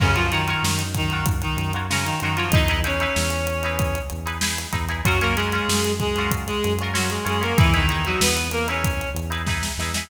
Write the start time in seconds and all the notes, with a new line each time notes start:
0.00 F#2 C#3 C#4 F4 F#4 A#4 C#5, kick, crash
0.15 F3 F4 F#4 A#4 C#5, closed hi-hat
0.31 D#3 D#4 F4 F#4 A#4 C#5, snare, closed hi-hat
0.48 F4 F#4 A#4 C#5, closed hi-hat
0.63 F#2, snare
0.79 closed hi-hat
0.95 D#3 D#4, kick, closed hi-hat
1.10 F4 F#4 A#4, closed hi-hat
1.14 C#5
1.26 kick, closed hi-hat
1.42 D#3 D#4, closed hi-hat
1.57 F#2, closed hi-hat
1.73 F4 F#4 A#4 C#5, closed hi-hat
1.90 C#3 C#4 F4 F#4 A#4 C#5, snare
2.05 D#3 D#4, closed hi-hat
2.20 F#2 D#3 D#4 F4 F#4, closed hi-hat
2.24 A#4 C#5
2.36 F3 F4 F#4 A#4 C#5, closed hi-hat
2.51 E2 D#4 E4 D#5, kick, closed hi-hat
2.55 G#4 B4
2.68 D#4 E4 G#4 B4, closed hi-hat
2.84 C#4 D#4 E4 G#4 B4 C#5, closed hi-hat
3.00 D#4 E4 G#4 B4, closed hi-hat
3.16 E2, snare
3.30 closed hi-hat
3.47 closed hi-hat
3.63 D#4 E4 G#4 B4, closed hi-hat
3.79 kick, closed hi-hat
3.95 closed hi-hat
4.10 E2, closed hi-hat
4.26 D#4 E4 G#4 B4, closed hi-hat
4.41 D#4 E4 G#4 B4, snare
4.58 closed hi-hat
4.73 E2 D#4 E4 G#4 B4, kick, closed hi-hat
4.89 D#4 E4 G#4 B4, closed hi-hat
5.05 F#2 F#3 C#4 F4 F#4 A#4, kick, closed hi-hat
5.20 A#3 C#4 F4 F#4 A#4, closed hi-hat
5.36 G#3 C#4 F4 F#4 G#4 A#4, closed hi-hat
5.52 C#4 F4 F#4 A#4, closed hi-hat
5.68 F#2, snare
5.84 snare, closed hi-hat
6.00 G#3 G#4, kick, closed hi-hat
6.16 C#4 F4 F#4, snare, closed hi-hat
6.20 A#4
6.31 kick, closed hi-hat
6.47 G#3 G#4, closed hi-hat
6.63 F#2, snare, closed hi-hat
6.79 C#4 F4 F#4, closed hi-hat
6.83 A#4
6.94 F#3 C#4 F4 F#4 A#4, snare
7.10 G#3 G#4, closed hi-hat
7.25 F#2 G#3 C#4 F4 F#4 G#4 A#4, closed hi-hat
7.41 A#3 C#4 F4 F#4 A#4, closed hi-hat
7.58 E2 E3 D#4 E4 G#4 B4, kick, closed hi-hat
7.73 D#3 D#4 E4 G#4 B4, snare, closed hi-hat
7.89 D#4 E4 G#4 B4, closed hi-hat
8.05 F#3 D#4 E4 F#4 G#4, closed hi-hat
8.09 B4
8.21 E2 B3 B4, snare
8.37 closed hi-hat
8.51 A#3 A#4, closed hi-hat
8.68 C#4 D#4 E4 G#4 B4 C#5, closed hi-hat
8.84 kick, closed hi-hat
9.01 closed hi-hat
9.14 E2, closed hi-hat
9.30 D#4 E4 G#4 B4, closed hi-hat
9.47 D#4 E4 G#4 B4, kick, snare
9.63 snare
9.78 E2 D#4 E4 G#4 B4, snare
9.94 D#4 E4 G#4 B4, snare